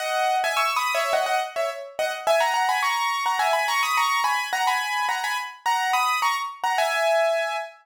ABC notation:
X:1
M:4/4
L:1/16
Q:1/4=106
K:G#m
V:1 name="Acoustic Grand Piano"
[df]3 [eg] (3[c'e']2 [bd']2 [ce]2 [df] [df] z [ce] z2 [df] z | [eg] [fa] [fa] [gb] [ac']3 [fa] [eg] [gb] [ac'] [bd'] [ac']2 [gb]2 | [fa] [gb]3 [fa] [gb] z2 [fa]2 [bd']2 [ac'] z2 [fa] | [eg]6 z10 |]